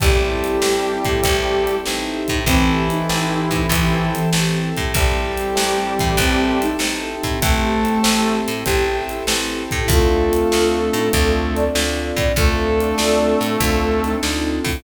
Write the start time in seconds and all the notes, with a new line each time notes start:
0.00 A1 G3 C4 E4 G4 A4 C5 E5 G5 A5, kick, closed hi-hat
0.44 closed hi-hat
0.62 A1 C5 E5 G5 A5, snare
1.05 A2, kick, closed hi-hat
1.23 A1 C4 E4 G4 A4 C5 E5 G5 A5, kick, closed hi-hat
1.67 closed hi-hat
1.85 A1 D#4 C5 E5 G5 A5, snare
2.28 A2, kick, closed hi-hat
2.46 A1 E3 C4 E4 G4 A4 C5 E5 G5 A5, kick, closed hi-hat
2.90 D#4, closed hi-hat
3.09 A1 C5 E5 G5 A5, snare
3.51 A2, kick, closed hi-hat
3.69 A1 E3 C4 E4 G4 A4 C5 E5 G5 A5, kick, closed hi-hat
4.14 E3, closed hi-hat
4.33 A1 C5 E5 G5 A5, snare
4.76 A2 G3, kick, closed hi-hat
4.94 A1 G3 C4 E4 G4 A4 C5 E5 G5 A5, kick, closed hi-hat
5.37 closed hi-hat
5.55 A1 C5 E5 G5 A5, snare
5.99 A2 E3, kick, closed hi-hat
6.17 A1 C4 E4 G4 A4 C5 E5 G5 A5, kick, closed hi-hat
6.62 D#4, closed hi-hat
6.79 A1 C5 E5 G5 A5, snare
7.23 A2, kick, closed hi-hat
7.42 A1 A3 C4 E4 G4 A4 C5 E5 G5 A5, kick, closed hi-hat
7.85 closed hi-hat
8.03 A1 C5 E5 G5 A5, snare
8.48 A2, closed hi-hat
8.66 A1 C4 E4 G4 A4 C5 E5 G5 A5, kick, closed hi-hat
9.09 E4, closed hi-hat
9.27 A1 C5 E5 G5 A5, snare
9.71 A2, kick, closed hi-hat
9.88 D2 A3 C4 D4 F4 A4, kick, closed hi-hat
10.33 closed hi-hat
10.51 D2 C4 D4 F4 A4, snare
10.93 A2 D#4, closed hi-hat
11.12 D2 C4 D4 F4 A4, kick, closed hi-hat
11.56 D5, closed hi-hat
11.75 D2 C4 D4 F4 A4, snare
12.16 A2, kick, closed hi-hat
12.36 D2 A3 C4 D4 F4 A4, kick, closed hi-hat
12.80 D5, closed hi-hat
12.98 D2 C4 D4 F4 A4, snare
13.41 A2, closed hi-hat
13.60 D2 C4 D4 F4 A4, kick, closed hi-hat
14.04 D#4, closed hi-hat
14.23 D2 C4 D4 F4 A4, snare
14.64 A2 E4, kick, open hi-hat